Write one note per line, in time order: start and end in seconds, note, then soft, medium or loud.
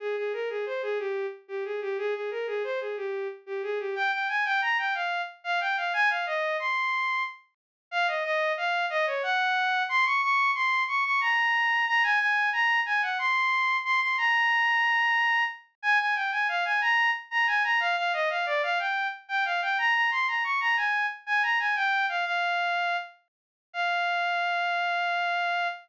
0.00 0.16 G#4 medium
0.17 0.32 G#4 medium
0.33 0.49 A#4 medium
0.49 0.65 G#4 medium
0.66 0.82 C5 medium
0.82 0.98 G#4 loud
0.99 1.26 G4 medium
1.48 1.64 G4 medium
1.65 1.80 G#4 medium
1.81 1.97 G4 medium
1.98 2.14 G#4 loud
2.14 2.30 G#4 medium
2.31 2.47 A#4 medium
2.47 2.63 G#4 medium
2.64 2.79 C5 medium
2.80 2.96 G#4 medium
2.97 3.28 G4 medium
3.46 3.62 G4 medium
3.63 3.78 G#4 medium
3.79 3.95 G4 medium
3.95 4.11 G5 loud
4.12 4.28 G5 medium
4.29 4.44 G#5 medium
4.45 4.61 G5 loud
4.62 4.77 A#5 medium
4.78 4.94 G5 medium
4.94 5.22 F5 medium
5.44 5.60 F5 loud
5.60 5.76 G5 medium
5.77 5.93 F5 medium
5.93 6.09 G#5 loud
6.10 6.25 F5 medium
6.26 6.57 D#5 medium
6.59 7.23 C6 medium
7.91 8.07 F5 loud
8.08 8.23 D#5 medium
8.24 8.52 D#5 loud
8.57 8.86 F5 loud
8.90 9.06 D#5 loud
9.07 9.22 C#5 medium
9.23 9.83 F#5 loud
9.89 10.05 C6 loud
10.05 10.21 C#6 loud
10.22 10.51 C#6 loud
10.55 10.83 C6 loud
10.88 11.04 C#6 loud
11.05 11.20 C#6 loud
11.21 11.85 A#5 loud
11.87 12.03 A#5 loud
12.03 12.19 G#5 loud
12.20 12.50 G#5 loud
12.53 12.80 A#5 loud
12.86 13.02 G#5 loud
13.02 13.18 F#5 medium
13.19 13.77 C6 loud
13.84 14.00 C6 loud
14.01 14.17 C6 medium
14.18 15.44 A#5 loud
15.82 15.98 G#5 loud
15.99 16.15 G#5 medium
16.15 16.31 G5 medium
16.32 16.47 G#5 medium
16.48 16.64 F5 loud
16.65 16.81 G#5 medium
16.81 17.10 A#5 loud
17.31 17.46 A#5 loud
17.47 17.63 G#5 loud
17.64 17.80 A#5 loud
17.80 17.96 F5 loud
17.97 18.12 F5 loud
18.13 18.29 D#5 loud
18.30 18.45 F5 medium
18.46 18.62 D5 loud
18.63 18.78 F5 loud
18.79 19.07 G5 medium
19.28 19.44 G5 loud
19.45 19.61 F5 medium
19.62 19.77 G5 medium
19.78 19.94 A#5 loud
19.95 20.10 A#5 medium
20.11 20.27 C6 loud
20.28 20.43 A#5 medium
20.44 20.60 C#6 medium
20.60 20.76 A#5 loud
20.77 21.06 G#5 medium
21.26 21.42 G#5 loud
21.43 21.58 A#5 medium
21.59 21.75 G#5 medium
21.76 22.06 G5 loud
22.09 22.25 F5 medium
22.25 22.97 F5 loud
23.73 25.68 F5 loud